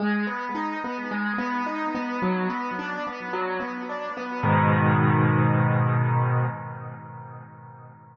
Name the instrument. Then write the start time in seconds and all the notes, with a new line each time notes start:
acoustic grand piano
0.00 G#3
0.27 B3
0.55 D#4
0.84 B3
1.11 G#3
1.38 B3
1.66 D#4
1.95 B3
2.22 F#3
2.50 B3
2.79 D4
3.07 B3
3.33 F#3
3.60 B3
3.89 D4
4.17 B3
4.43 G#2 B2 D#3